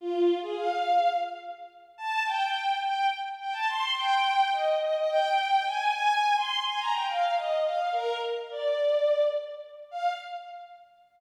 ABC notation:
X:1
M:7/8
L:1/16
Q:1/4=106
K:Fdor
V:1 name="Violin"
F3 A f4 z6 | =a2 g4 g2 z2 g a c'2 | g4 e2 e e g4 a2 | a3 c'2 a b g f2 e2 f2 |
B2 z2 d6 z4 | f4 z10 |]